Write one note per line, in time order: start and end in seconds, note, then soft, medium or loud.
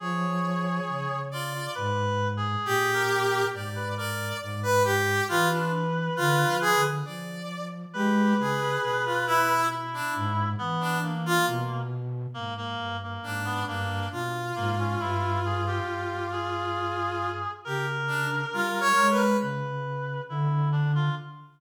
0.00 0.80 F3 loud
0.00 1.18 G#4 medium
0.00 1.20 C#5 medium
0.88 1.67 C#3 medium
1.31 1.53 F4 medium
1.31 1.71 D5 medium
1.54 1.74 F4 medium
1.75 2.56 G#2 loud
1.75 2.28 B4 loud
2.37 2.90 G#4 loud
2.65 3.44 A#2 medium
2.65 3.45 G4 loud
2.94 3.47 A#4 loud
3.53 4.33 G#2 medium
3.53 3.94 D5 medium
3.75 3.95 B4 medium
3.97 4.37 A#4 medium
3.97 4.37 D5 medium
4.40 5.21 G#2 loud
4.40 4.60 D5 medium
4.63 4.83 B4 loud
4.84 5.24 G4 loud
5.28 6.09 E3 medium
5.28 5.48 F4 loud
5.28 6.89 B4 medium
5.51 5.71 D4 medium
6.17 6.44 D3 loud
6.17 6.56 F4 loud
6.47 6.73 F3 soft
6.61 6.81 G#4 loud
6.76 7.03 D3 medium
7.05 7.86 F3 medium
7.05 7.65 D5 medium
7.93 8.34 G#3 loud
7.93 8.34 G4 medium
7.93 9.52 B4 loud
8.38 8.78 C#3 medium
8.38 8.80 G#4 medium
8.82 10.02 B2 medium
8.82 9.02 G#4 medium
9.05 9.25 F4 medium
9.27 9.66 E4 loud
9.70 10.49 E4 medium
9.94 10.14 D4 medium
10.15 10.55 G#2 loud
10.58 11.38 E3 medium
10.58 10.98 B3 loud
10.81 11.00 D4 medium
11.02 11.82 A#3 medium
11.26 11.46 F4 loud
11.47 12.26 B2 loud
12.34 12.75 G#2 medium
12.34 12.54 A#3 medium
12.57 12.97 A#3 medium
12.79 13.19 G2 medium
13.03 13.43 A#3 medium
13.23 13.63 G#2 medium
13.23 13.63 D4 medium
13.45 13.65 B3 medium
13.67 14.08 G2 loud
13.67 14.07 A#3 medium
13.67 14.07 D4 medium
14.12 14.52 B2 medium
14.12 17.29 F4 medium
14.56 14.96 G#2 loud
14.56 14.75 A#3 medium
14.79 14.99 C#4 medium
15.00 15.80 G2 loud
15.00 15.39 E4 medium
15.45 15.65 G#4 medium
15.67 16.27 G4 medium
15.88 17.47 G2 medium
16.32 17.51 G#4 medium
17.65 18.45 C#3 medium
17.65 17.86 G4 medium
17.65 19.24 A#4 loud
18.07 18.27 D4 medium
18.53 18.93 G3 medium
18.53 18.80 F4 medium
18.81 19.07 C#5 loud
18.97 19.37 G#3 medium
19.10 19.37 B4 medium
19.41 20.20 C#3 medium
19.41 20.22 B4 medium
20.29 21.09 D3 loud
20.29 20.69 E4 medium
20.72 20.92 D4 medium
20.95 21.15 F4 medium